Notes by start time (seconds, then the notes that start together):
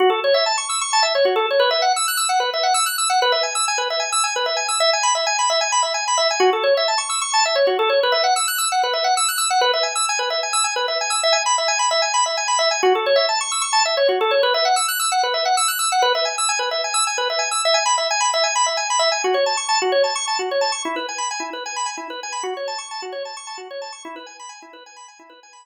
0.00 F#4
0.10 A4
0.24 C#5
0.34 E5
0.46 A5
0.58 C#6
0.69 E6
0.81 C#6
0.93 A5
1.03 E5
1.15 C#5
1.25 F#4
1.36 A4
1.51 C#5
1.60 B4
1.71 E5
1.82 F#5
1.96 E6
2.08 F#6
2.17 E6
2.29 F#5
2.40 B4
2.54 E5
2.63 F#5
2.74 E6
2.86 F#6
2.98 E6
3.10 F#5
3.22 B4
3.32 E5
3.43 G#5
3.55 E6
3.68 G#5
3.78 B4
3.90 E5
4.00 G#5
4.12 E6
4.24 G#5
4.36 B4
4.46 E5
4.57 G#5
4.69 E6
4.80 E5
4.93 G#5
5.03 B5
5.15 E5
5.27 G#5
5.39 B5
5.50 E5
5.61 G#5
5.72 B5
5.83 E5
5.94 G#5
6.08 B5
6.18 E5
6.31 G#5
6.40 F#4
6.53 A4
6.63 C#5
6.77 E5
6.88 A5
6.98 C#6
7.09 E6
7.21 C#6
7.34 A5
7.45 E5
7.55 C#5
7.67 F#4
7.79 A4
7.90 C#5
8.03 B4
8.12 E5
8.24 F#5
8.36 E6
8.48 F#6
8.58 E6
8.72 F#5
8.83 B4
8.93 E5
9.04 F#5
9.17 E6
9.28 F#6
9.38 E6
9.50 F#5
9.61 B4
9.73 E5
9.83 G#5
9.95 E6
10.09 G#5
10.19 B4
10.30 E5
10.43 G#5
10.53 E6
10.64 G#5
10.76 B4
10.88 E5
11.01 G#5
11.10 E6
11.23 E5
11.33 G#5
11.46 B5
11.58 E5
11.68 G#5
11.79 B5
11.91 E5
12.02 G#5
12.14 B5
12.26 E5
12.37 G#5
12.48 B5
12.59 E5
12.71 G#5
12.83 F#4
12.95 A4
13.06 C#5
13.16 E5
13.29 A5
13.41 C#6
13.52 E6
13.61 C#6
13.73 A5
13.85 E5
13.97 C#5
14.09 F#4
14.21 A4
14.31 C#5
14.43 B4
14.54 E5
14.65 F#5
14.76 E6
14.88 F#6
14.99 E6
15.12 F#5
15.23 B4
15.34 E5
15.45 F#5
15.57 E6
15.68 F#6
15.79 E6
15.92 F#5
16.02 B4
16.15 E5
16.25 G#5
16.38 E6
16.49 G#5
16.59 B4
16.71 E5
16.84 G#5
16.94 E6
17.07 G#5
17.18 B4
17.30 E5
17.39 G#5
17.51 E6
17.65 E5
17.74 G#5
17.86 B5
17.98 E5
18.11 G#5
18.21 B5
18.34 E5
18.44 G#5
18.56 B5
18.66 E5
18.77 G#5
18.90 B5
18.99 E5
19.12 G#5
19.24 F#4
19.34 C#5
19.46 A5
19.57 C#6
19.69 A5
19.82 F#4
19.92 C#5
20.04 A5
20.15 C#6
20.27 A5
20.39 F#4
20.51 C#5
20.61 A5
20.72 C#6
20.85 E4
20.96 B4
21.09 G#5
21.18 B5
21.31 G#5
21.40 E4
21.53 B4
21.66 G#5
21.76 B5
21.86 G#5
21.97 E4
22.10 B4
22.23 G#5
22.32 B5
22.43 F#4
22.57 C#5
22.68 A5
22.78 C#6
22.91 A5
23.02 F#4
23.12 C#5
23.25 A5
23.37 C#6
23.47 A5
23.58 F#4
23.71 C#5
23.82 A5
23.92 C#6
24.05 E4
24.16 B4
24.26 G#5
24.40 B5
24.49 G#5
24.62 E4
24.73 B4
24.86 G#5
24.97 B5
25.08 G#5
25.19 E4
25.30 B4
25.43 G#5
25.53 B5